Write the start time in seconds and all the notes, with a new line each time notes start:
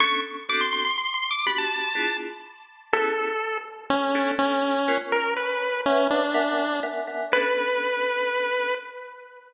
0.00 B3 C#4 D4 A4 C#6
0.49 B3 C4 D4 F#4 A4 D6
0.61 C6
0.73 C6
0.85 C6
0.98 C6
1.14 C6
1.31 D6
1.46 B3 D4 F#4 G4 B5
1.58 A5
1.95 B3 D4 E4 F4 G#4
2.93 B3 C#4 E4 G#4 A4
3.90 C#4
4.15 B3 C#4 D4 A4
4.39 C#4
4.88 B3 C#4 F4 A#4
5.12 A#4
5.36 B4
5.85 C#4 B4 C#5 E5 F#5
6.10 D4
6.34 B3 A#4 E5 F#5 G#5
6.83 B3 A#4 E5 F#5 G#5
7.07 B3 A#4 E5 F#5 G#5
7.32 B3 C#4 D4 A4 B4